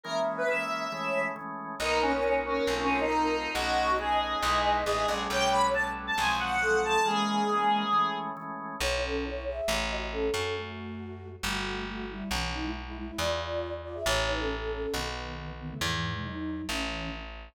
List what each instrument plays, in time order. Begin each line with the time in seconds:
0.03 drawbar organ E3 G#3 A#3 C#4, lead 1 (square) A#4, flute E5
0.37 lead 1 (square) B4
0.48 drawbar organ E3 G#3 A#3 C#4, lead 1 (square) E5
0.92 drawbar organ E3 G#3 A3 C#4, flute C#5
1.36 drawbar organ E3 G#3 A3 C#4
1.80 electric bass (finger) B1, drawbar organ A#3 B3 D#4 F#4, lead 1 (square) D#4, flute A#4
2.02 lead 1 (square) C#4
2.13 lead 1 (square) C#4
2.23 drawbar organ A#3 B3 D#4 F#4, lead 1 (square) C#4
2.46 lead 1 (square) C#4
2.67 electric bass (finger) B1, drawbar organ A3 C4 D#4 F4
2.79 lead 1 (square) C#4
3.00 lead 1 (square) D#4
3.11 drawbar organ A3 C4 D#4 F4
3.54 electric bass (finger) B1, drawbar organ A3 B3 C#4 D#4, lead 1 (square) F#4, flute D#5
3.98 drawbar organ A3 B3 C#4 D#4, lead 1 (square) G#4
4.43 electric bass (finger) B1, drawbar organ G#3 B3 D#4 E4
4.85 electric bass (finger) A1, drawbar organ G#3 B3 D#4 E4, lead 1 (square) G#4
5.08 electric bass (finger) A#1, drawbar organ G3 A3 B3 C#4
5.30 electric bass (finger) B1, flute C#5, lead 1 (square) G5
5.51 lead 1 (square) B5
5.74 drawbar organ G3 A3 B3 C#4, lead 1 (square) A5
6.07 lead 1 (square) A5
6.18 electric bass (finger) B1, drawbar organ F3 F#3 G#3 C4, lead 1 (square) G#5
6.40 lead 1 (square) F#5
6.61 drawbar organ F3 F#3 G#3 C4, flute A4
6.84 lead 1 (square) A5
7.05 drawbar organ E3 G#3 A#3 C#4, flute G#3, lead 1 (square) G#4
7.49 drawbar organ E3 G#3 A#3 C#4
7.93 drawbar organ E3 G#3 A3 C#4
8.37 drawbar organ E3 G#3 A3 C#4
8.80 electric bass (finger) B1, flute E4 C#5
9.03 flute C#4 A4
9.24 flute E4 C#5
9.47 flute G#4 E5
9.68 electric bass (finger) A1
9.89 flute F#4 D#5
10.11 flute C#4 A4
10.34 electric bass (finger) F#2, flute C#4 A4
10.56 flute A3 F#4
11.43 electric bass (finger) G1, flute A3 F#4
11.87 flute A3 F#4
12.09 flute G3 E4
12.31 electric bass (finger) B1, flute E3 C#4
12.53 flute F#3 D#4
12.64 flute G#3 E4
12.87 flute G#3 E4
12.96 flute G#3 E4
13.07 flute G#3 E4
13.18 electric bass (finger) E2, flute F4 D5
13.84 flute F4 D5
13.94 flute G#4 E5
14.06 electric bass (finger) A1, flute E4 C#5
14.28 flute D#4 B4
14.39 flute C#4 A4
14.61 flute C#4 A4
14.72 flute C#4 A4
14.83 flute C#4 A4
14.93 electric bass (finger) B1, flute D#3 B3
15.59 flute D#3 B3
15.70 flute C#3 A3
15.81 electric bass (finger) E2, flute G#2 E3
15.92 flute G#2 E3
16.14 flute B2 G#3
16.24 flute F#3 D#4
16.69 electric bass (finger) A1, flute E3 C#4